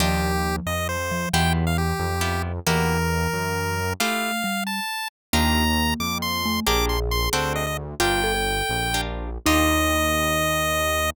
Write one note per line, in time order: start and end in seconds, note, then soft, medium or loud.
0.00 0.60 D#2 medium
0.00 0.97 F3 medium
0.00 0.31 D4 loud
0.00 0.31 D#4 medium
0.00 0.31 F4 loud
0.00 0.56 G4 medium
0.00 0.31 G4 loud
0.66 1.26 F2 medium
0.66 0.88 D#5 medium
0.89 1.29 C5 medium
1.11 1.31 F3 medium
1.33 1.93 E2 loud
1.33 2.11 E3 medium
1.33 1.65 B3 loud
1.33 1.65 E4 loud
1.33 1.65 F4 medium
1.33 1.65 G4 loud
1.33 1.53 G5 medium
1.67 1.77 F5 medium
1.78 2.42 G4 medium
2.00 2.60 F2 medium
2.21 2.52 B3 medium
2.21 2.52 E4 loud
2.21 2.52 F4 medium
2.21 2.52 G4 medium
2.67 3.27 E2 medium
2.67 3.80 E3 medium
2.67 2.98 A#3 loud
2.67 2.98 E4 loud
2.67 2.98 F#4 loud
2.67 2.98 G4 loud
2.67 3.93 A#4 medium
3.33 3.93 F#2 medium
4.00 4.31 A3 loud
4.00 4.43 A3 medium
4.00 4.31 E4 loud
4.00 4.31 F4 loud
4.00 4.31 G4 loud
4.00 4.64 F5 medium
4.44 4.80 G3 medium
4.67 5.08 A5 medium
5.33 5.94 D#2 loud
5.33 6.42 A#3 medium
5.33 5.64 D4 loud
5.33 5.64 D#4 loud
5.33 5.64 F4 loud
5.33 5.64 G4 loud
5.33 5.94 A#5 medium
6.00 6.60 F2 medium
6.00 6.18 D6 medium
6.22 6.60 C6 medium
6.45 6.65 A3 medium
6.66 7.29 A#1 loud
6.66 6.98 D4 loud
6.66 6.98 G4 loud
6.66 6.98 G#4 loud
6.66 7.85 G#4 medium
6.66 6.98 A#4 loud
6.66 6.86 D6 medium
6.89 7.00 C6 medium
7.11 7.29 C6 medium
7.33 7.95 D2 loud
7.33 7.64 C4 loud
7.33 7.64 D4 medium
7.33 7.64 F#4 loud
7.33 7.64 A4 loud
7.33 7.53 C5 medium
7.56 7.66 D#5 medium
7.67 7.77 D#5 medium
8.00 8.62 G1 loud
8.00 8.32 D4 loud
8.00 8.21 F4 medium
8.00 8.32 F4 loud
8.00 8.32 G4 loud
8.00 8.32 A#4 loud
8.00 9.01 G5 medium
8.24 8.34 A4 medium
8.34 8.89 A4 medium
8.69 9.38 A#1 medium
8.94 9.30 D4 medium
8.94 9.30 F4 medium
8.94 9.30 G4 medium
8.94 9.30 A#4 medium
9.46 11.10 D#2 loud
9.46 11.10 D4 medium
9.46 11.09 D#4 loud
9.46 11.10 D#4 loud
9.46 11.10 F4 loud
9.46 11.10 G4 loud
9.46 11.10 D#5 loud